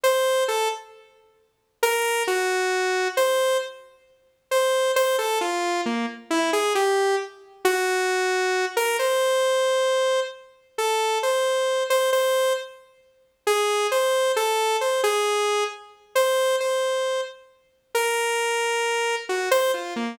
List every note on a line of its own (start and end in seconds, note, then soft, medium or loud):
0.04 0.44 C5 medium
0.48 0.68 A4 medium
1.83 2.23 A#4 loud
2.27 3.08 F#4 medium
3.17 3.57 C5 medium
4.51 4.92 C5 medium
4.96 5.16 C5 loud
5.18 5.39 A4 medium
5.41 5.81 F4 medium
5.86 6.06 A#3 medium
6.30 6.51 E4 medium
6.53 6.73 G#4 medium
6.75 7.15 G4 medium
7.65 8.65 F#4 loud
8.77 8.97 A#4 loud
8.99 10.20 C5 medium
10.78 11.18 A4 medium
11.23 11.83 C5 medium
11.90 12.10 C5 medium
12.13 12.53 C5 loud
13.47 13.87 G#4 medium
13.92 14.32 C5 medium
14.36 14.77 A4 medium
14.81 15.01 C5 medium
15.04 15.64 G#4 medium
16.15 16.56 C5 medium
16.60 17.21 C5 medium
17.95 19.15 A#4 medium
19.29 19.49 F#4 medium
19.51 19.71 C5 loud
19.74 19.94 F4 medium
19.96 20.16 A#3 medium